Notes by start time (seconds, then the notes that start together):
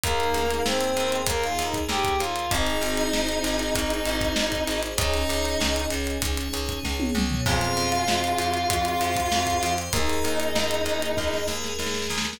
0.03 D#2 A#3 D#4 G#4 A#4 D#5 G#5, kick, closed hi-hat
0.20 closed hi-hat
0.34 C#2, closed hi-hat
0.51 closed hi-hat
0.66 D#2 C4 C5, snare
0.81 closed hi-hat
0.96 D#2, closed hi-hat
1.12 closed hi-hat
1.27 D#2 A#3 G#4 A#4 G#5, kick, closed hi-hat
1.44 F4 F5, closed hi-hat
1.59 D#2 D#4 D#5, closed hi-hat
1.74 kick, closed hi-hat
1.89 D#2 G4 G5, snare
2.04 kick, closed hi-hat
2.19 D#2 F4 F5, closed hi-hat
2.36 closed hi-hat
2.50 G#1 C4 D#4 G#4 C5 D#5 G#5, kick, closed hi-hat
2.66 closed hi-hat
2.81 G#1, closed hi-hat
2.97 closed hi-hat
3.13 G#1, snare
3.29 closed hi-hat
3.44 G#1, closed hi-hat
3.59 closed hi-hat
3.75 G#1 G#4 C5 G#5, kick, closed hi-hat
3.90 closed hi-hat
4.06 G#1, closed hi-hat
4.21 kick, closed hi-hat
4.36 G#1, snare
4.52 kick, closed hi-hat
4.67 G#1, closed hi-hat
4.83 closed hi-hat
4.97 C#2 C#4 D#4 G#4 C#5 D#5 G#5, kick, closed hi-hat
5.14 closed hi-hat
5.29 C#2, closed hi-hat
5.45 closed hi-hat
5.60 C#2, snare
5.76 closed hi-hat
5.90 C#2, closed hi-hat
6.07 closed hi-hat
6.21 C#2 G#4 C#5 G#5, kick, closed hi-hat
6.37 closed hi-hat
6.53 C#2, closed hi-hat
6.69 kick, closed hi-hat
6.84 C#2, kick, snare
7.00 high tom
7.15 C#2, mid tom
7.30 floor tom
7.46 F2 C4 F4 G#4 C5 F5 G#5, kick, crash
7.61 closed hi-hat
7.77 F2, closed hi-hat
7.92 closed hi-hat
8.08 F2, snare
8.24 closed hi-hat
8.38 F2, closed hi-hat
8.54 closed hi-hat
8.69 F2 C5 G#5 C6, kick, closed hi-hat
8.85 closed hi-hat
9.01 F2, closed hi-hat
9.16 kick, closed hi-hat
9.32 F2, snare
9.47 kick, closed hi-hat
9.63 F2, closed hi-hat
9.78 closed hi-hat
9.93 D#2 A#3 D#4 G#4 A#4 D#5 G#5, kick, closed hi-hat
10.10 closed hi-hat
10.24 D#2, closed hi-hat
10.40 closed hi-hat
10.55 D#2, snare
10.71 closed hi-hat
10.85 D#2, closed hi-hat
11.02 closed hi-hat
11.17 D#2 G#4 A#4 G#5, kick, snare
11.33 snare
11.48 D#2, snare
11.64 snare
11.79 D#2, snare
11.86 snare
11.94 snare
12.02 snare
12.10 D#2, snare
12.18 snare
12.25 snare
12.33 snare